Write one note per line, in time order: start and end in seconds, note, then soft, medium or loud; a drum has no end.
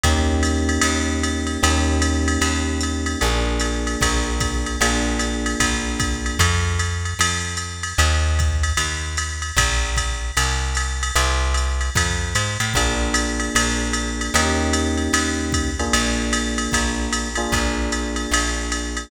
0.03 0.78 D#2 loud
0.03 1.61 A#3 medium
0.03 1.61 C#4 medium
0.03 1.61 D#4 medium
0.03 1.61 G4 medium
0.03 kick medium
0.03 ride medium
0.43 hi-hat pedal medium
0.43 ride medium
0.69 ride medium
0.81 1.58 D#2 medium
0.81 ride medium
1.23 hi-hat pedal medium
1.23 ride medium
1.47 ride medium
1.63 2.38 D#2 loud
1.63 3.19 A#3 medium
1.63 3.19 C#4 medium
1.63 3.19 D#4 medium
1.63 3.19 G4 medium
1.63 ride medium
2.02 hi-hat pedal medium
2.02 ride medium
2.28 ride medium
2.41 3.16 D#2 medium
2.41 ride medium
2.81 hi-hat pedal medium
2.81 ride medium
3.06 ride medium
3.21 3.97 A#1 loud
3.21 4.78 A#3 medium
3.21 4.78 D4 medium
3.21 4.78 F4 medium
3.21 4.78 G#4 medium
3.21 ride medium
3.60 hi-hat pedal medium
3.60 ride medium
3.87 ride medium
4.01 4.76 A#1 medium
4.01 kick medium
4.01 ride medium
4.40 kick medium
4.40 hi-hat pedal medium
4.40 ride medium
4.66 ride medium
4.81 5.55 A#1 medium
4.81 6.38 A#3 medium
4.81 6.38 D4 medium
4.81 6.38 F4 medium
4.81 6.38 G#4 medium
4.81 ride medium
5.19 hi-hat pedal medium
5.19 ride medium
5.46 ride medium
5.60 6.35 A#1 medium
5.60 kick soft
5.60 ride medium
6.00 kick medium
6.00 hi-hat pedal medium
6.00 ride medium
6.26 ride medium
6.39 7.14 F2 loud
6.39 kick soft
6.39 ride medium
6.79 hi-hat pedal medium
6.79 ride medium
7.05 ride medium
7.19 7.94 F2 medium
7.19 ride loud
7.57 hi-hat pedal medium
7.57 ride medium
7.83 ride medium
7.98 8.73 D#2 loud
7.98 ride medium
8.39 kick medium
8.39 hi-hat pedal medium
8.39 ride medium
8.63 ride medium
8.77 9.52 D#2 medium
8.77 ride medium
9.17 hi-hat pedal medium
9.17 ride medium
9.42 ride medium
9.57 10.31 A#1 loud
9.57 kick medium
9.57 ride loud
9.97 kick soft
9.97 hi-hat pedal medium
9.97 ride medium
10.37 11.11 C2 loud
10.37 ride medium
10.75 hi-hat pedal medium
10.75 ride medium
11.03 ride medium
11.15 11.90 C2 loud
11.15 ride medium
11.54 hi-hat pedal medium
11.54 ride medium
11.81 ride medium
11.95 12.34 F2 medium
11.95 kick medium
11.95 ride medium
12.35 12.58 G#2 medium
12.35 hi-hat pedal medium
12.35 ride medium
12.60 12.73 A2 medium
12.60 ride medium
12.74 13.50 A#1 medium
12.74 14.33 A#3 medium
12.74 14.33 D4 medium
12.74 14.33 F4 medium
12.74 14.33 G#4 medium
12.74 kick medium
12.74 ride medium
13.14 hi-hat pedal medium
13.14 ride medium
13.40 ride medium
13.55 14.30 A#1 medium
13.55 ride loud
13.93 hi-hat pedal medium
13.93 ride medium
14.21 ride medium
14.34 15.09 D#2 loud
14.34 15.70 A#3 medium
14.34 15.70 C#4 medium
14.34 15.70 D#4 medium
14.34 15.70 G4 medium
14.34 ride medium
14.73 hi-hat pedal medium
14.73 ride medium
14.97 ride medium
15.13 15.88 D#2 medium
15.13 ride medium
15.52 kick medium
15.52 hi-hat pedal medium
15.52 ride medium
15.79 17.28 A#3 medium
15.79 17.28 D4 medium
15.79 17.28 F4 medium
15.79 17.28 G#4 medium
15.79 ride medium
15.93 16.68 A#1 medium
15.93 ride medium
16.33 hi-hat pedal medium
16.33 ride medium
16.58 ride medium
16.72 17.48 A#1 medium
16.72 kick soft
16.72 ride medium
17.13 hi-hat pedal medium
17.13 ride medium
17.35 19.09 A#3 medium
17.35 19.09 D4 medium
17.35 19.09 F4 medium
17.35 19.09 G#4 medium
17.35 ride medium
17.52 18.27 A#1 medium
17.52 kick medium
17.52 ride medium
17.92 hi-hat pedal medium
17.92 ride medium
18.16 ride medium
18.31 19.06 A#1 medium
18.31 ride medium
18.72 hi-hat pedal medium
18.72 ride medium
18.97 ride medium